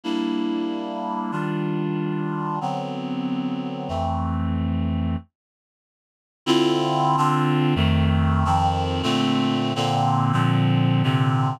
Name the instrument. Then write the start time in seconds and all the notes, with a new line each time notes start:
clarinet
0.04 G3 A#3 D4 E4
1.31 D#3 G3 D4 F4
2.61 D3 F#3 B3 C4
3.88 F2 E3 A3 C4
6.46 D3 C4 E4 F4
7.17 D3 C4 D4 F4
7.75 F2 D#3 A3 C4
8.45 F2 D#3 F3 C4
9.03 A#2 D3 A3 C4
9.75 A#2 D3 A#3 C4
10.32 A#2 D3 F3 C4
11.03 A#2 C3 D3 C4